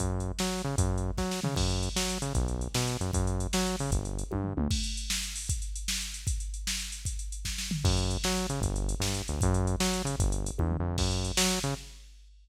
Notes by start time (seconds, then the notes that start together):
0.00 F#2, kick, closed hi-hat
0.20 closed hi-hat
0.39 F#3, snare
0.59 closed hi-hat
0.64 C#3
0.78 F#2, kick, closed hi-hat
0.98 closed hi-hat
1.18 F#3, kick, snare
1.31 snare
1.43 C#3, floor tom
1.56 F#2, kick, crash
1.70 closed hi-hat
1.83 closed hi-hat
1.96 F#3, snare
2.09 closed hi-hat
2.22 C#3, closed hi-hat
2.35 B1, kick, closed hi-hat
2.48 closed hi-hat
2.61 closed hi-hat
2.74 B2, snare
2.87 closed hi-hat
3.00 F#2, closed hi-hat
3.13 F#2, kick, closed hi-hat
3.27 closed hi-hat
3.40 closed hi-hat
3.53 F#3, snare
3.67 closed hi-hat
3.79 C#3, open hi-hat
3.91 G1, kick, closed hi-hat
4.05 closed hi-hat
4.19 closed hi-hat
4.31 G2, kick, high tom
4.44 floor tom
4.57 D2, mid tom
4.71 kick, crash
4.84 closed hi-hat
4.97 closed hi-hat
5.10 snare
5.23 closed hi-hat
5.36 open hi-hat
5.49 kick, closed hi-hat
5.62 closed hi-hat
5.76 closed hi-hat
5.88 snare
6.01 closed hi-hat
6.14 closed hi-hat
6.27 kick, closed hi-hat
6.40 closed hi-hat
6.54 closed hi-hat
6.67 snare
6.80 closed hi-hat
6.92 closed hi-hat
7.05 kick, closed hi-hat
7.19 closed hi-hat
7.32 closed hi-hat
7.45 kick, snare
7.58 snare
7.71 floor tom
7.84 F#2, kick, crash
7.97 closed hi-hat
8.10 closed hi-hat
8.24 F#3, snare
8.37 closed hi-hat
8.49 C#3, closed hi-hat
8.61 G1, kick, closed hi-hat
8.76 closed hi-hat
8.89 closed hi-hat
9.00 G2, snare
9.14 closed hi-hat
9.28 D2, closed hi-hat
9.41 F#2, kick, closed hi-hat
9.54 closed hi-hat
9.67 closed hi-hat
9.80 F#3, snare
9.93 closed hi-hat
10.05 C#3, closed hi-hat
10.18 G1, kick, closed hi-hat
10.32 closed hi-hat
10.46 closed hi-hat
10.58 E2, kick, high tom
10.72 floor tom
10.80 F2
10.98 F#2, kick, crash
11.11 closed hi-hat
11.25 closed hi-hat
11.37 F#3, snare
11.50 closed hi-hat
11.63 C#3, closed hi-hat